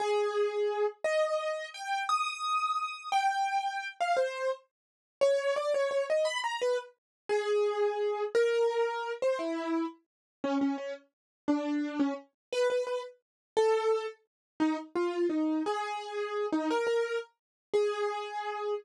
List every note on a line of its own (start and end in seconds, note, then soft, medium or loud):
0.00 0.86 G#4 loud
1.04 1.68 D#5 loud
1.74 2.04 G5 medium
2.09 3.09 D#6 medium
3.12 3.88 G5 loud
4.01 4.17 F5 medium
4.17 4.51 C5 medium
5.21 5.55 C#5 loud
5.56 5.73 D5 medium
5.74 5.90 C#5 medium
5.91 6.05 C#5 medium
6.10 6.26 D#5 medium
6.25 6.39 B5 loud
6.44 6.59 A#5 medium
6.62 6.77 B4 medium
7.29 8.23 G#4 loud
8.35 9.12 A#4 loud
9.22 9.39 C5 medium
9.39 9.85 E4 medium
10.44 10.58 C#4 medium
10.61 10.76 C#4 medium
10.78 10.93 C#4 medium
11.48 11.99 D4 medium
12.00 12.14 C#4 medium
12.53 12.67 B4 loud
12.70 12.84 B4 medium
12.87 13.02 B4 medium
13.57 14.06 A4 loud
14.60 14.77 D#4 loud
14.95 15.27 F4 medium
15.29 15.63 D#4 medium
15.66 16.46 G#4 medium
16.52 16.69 D#4 medium
16.71 16.86 A#4 loud
16.87 17.18 A#4 medium
17.74 18.74 G#4 loud